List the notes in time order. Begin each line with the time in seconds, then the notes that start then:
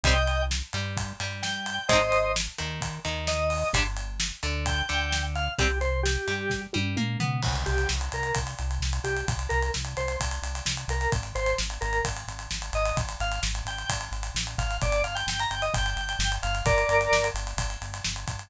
0.03 C2 G3 C4 D#5 G5, kick, closed hi-hat
0.27 closed hi-hat
0.51 snare
0.73 G2 G3, closed hi-hat
0.97 kick, closed hi-hat
1.20 G2 G3, closed hi-hat
1.42 G5, snare
1.66 closed hi-hat
1.89 G#1 G#3 C4 C5 D#5, kick, closed hi-hat
1.93 D#4
2.12 closed hi-hat
2.36 snare
2.58 D#2 D#3, closed hi-hat
2.81 kick, closed hi-hat
3.05 D#2 D#3, closed hi-hat
3.27 D#5, snare
3.50 open hi-hat
3.73 G1 G3 D4, kick, closed hi-hat
3.97 closed hi-hat
4.20 snare
4.43 D2 D3, closed hi-hat
4.66 G5, kick, closed hi-hat
4.89 D2 D3, closed hi-hat
5.12 snare
5.35 F5, closed hi-hat
5.58 C2 G3 C4 G4, kick, closed hi-hat
5.81 C5, closed hi-hat
6.03 G4, snare
6.28 G2 G3, closed hi-hat
6.50 kick, snare
6.73 G2 G3, high tom
6.96 A#2 A#3, mid tom
7.20 B2 B3, floor tom
7.42 C2, kick, crash
7.55 closed hi-hat
7.66 C2 G4, closed hi-hat
7.78 closed hi-hat
7.89 C2, snare
8.01 closed hi-hat
8.12 C2 A#4, closed hi-hat
8.23 closed hi-hat
8.35 C2, kick, closed hi-hat
8.47 closed hi-hat
8.59 C2, closed hi-hat
8.71 closed hi-hat
8.80 C2, snare
8.93 closed hi-hat
9.04 C2 G4, closed hi-hat
9.17 closed hi-hat
9.28 C2, kick, closed hi-hat
9.39 closed hi-hat
9.49 C2 A#4, closed hi-hat
9.62 closed hi-hat
9.74 C2, snare
9.85 closed hi-hat
9.97 C2 C5, closed hi-hat
10.08 closed hi-hat
10.20 C2, kick, closed hi-hat
10.31 closed hi-hat
10.42 C2, closed hi-hat
10.55 closed hi-hat
10.65 C2, snare
10.77 closed hi-hat
10.88 C2 A#4, closed hi-hat
11.01 closed hi-hat
11.12 G#1, kick, closed hi-hat
11.23 closed hi-hat
11.35 G#1 C5, closed hi-hat
11.46 closed hi-hat
11.58 G#1, snare
11.70 closed hi-hat
11.81 G#1 A#4, closed hi-hat
11.93 closed hi-hat
12.05 G#1, kick, closed hi-hat
12.17 closed hi-hat
12.28 G#1, closed hi-hat
12.39 closed hi-hat
12.51 G#1, snare
12.62 closed hi-hat
12.73 G#1 D#5, closed hi-hat
12.85 closed hi-hat
12.96 G#1, kick, closed hi-hat
13.09 closed hi-hat
13.20 G#1 F5, closed hi-hat
13.32 closed hi-hat
13.43 G#1, snare
13.55 closed hi-hat
13.65 G#1 G5, closed hi-hat
13.78 closed hi-hat
13.89 G#1, kick, closed hi-hat
14.01 closed hi-hat
14.11 G#1, closed hi-hat
14.23 closed hi-hat
14.34 A1, snare
14.47 closed hi-hat
14.58 G#1 F5, kick, closed hi-hat
14.71 closed hi-hat
14.82 G1 D5, kick, closed hi-hat
14.92 closed hi-hat
15.04 G1 F5, closed hi-hat
15.15 G5, closed hi-hat
15.27 G1 G5, snare
15.40 A#5, closed hi-hat
15.50 G1 G5, closed hi-hat
15.62 D#5, closed hi-hat
15.74 G1 G5, kick, closed hi-hat
15.86 closed hi-hat
15.96 G1, closed hi-hat
16.09 closed hi-hat
16.19 G1, snare
16.32 closed hi-hat
16.43 G1 F5, closed hi-hat
16.55 closed hi-hat
16.65 G1 A#4 D5, kick, closed hi-hat
16.78 closed hi-hat
16.89 G1, closed hi-hat
17.01 closed hi-hat
17.11 G1, snare
17.24 closed hi-hat
17.34 G1, closed hi-hat
17.47 closed hi-hat
17.57 G1, kick, closed hi-hat
17.70 closed hi-hat
17.81 G1, closed hi-hat
17.94 closed hi-hat
18.04 G1, snare
18.16 closed hi-hat
18.28 G1, kick, closed hi-hat
18.39 closed hi-hat